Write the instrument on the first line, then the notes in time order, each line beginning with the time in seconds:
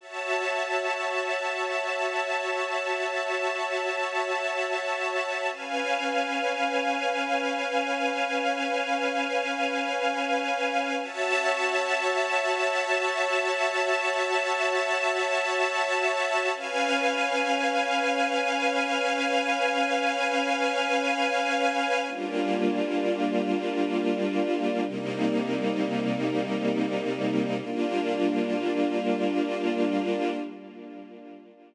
string ensemble 1
0.01 F#4 C#5 E5 A5
5.50 C#4 B4 F5 G#5
11.02 F#4 C#5 E5 A5
16.55 C#4 B4 F5 G#5
22.07 G3 A#3 D4 F4
24.84 C3 G3 A#3 D#4
27.59 G3 A#3 D4 F4